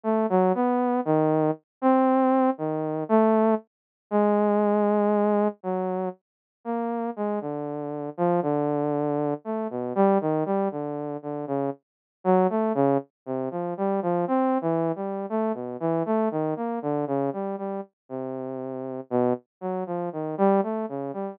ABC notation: X:1
M:7/8
L:1/16
Q:1/4=59
K:none
V:1 name="Lead 2 (sawtooth)"
A, ^F, B,2 ^D,2 z C3 D,2 A,2 | z2 ^G,6 ^F,2 z2 ^A,2 | ^G, D,3 F, D,4 A, B,, =G, ^D, G, | D,2 D, ^C, z2 ^F, A, C, z =C, =F, G, F, |
(3C2 E,2 G,2 A, B,, E, A, ^D, ^A, =D, ^C, G, G, | z C,4 B,, z ^F, =F, ^D, G, A, ^C, G, |]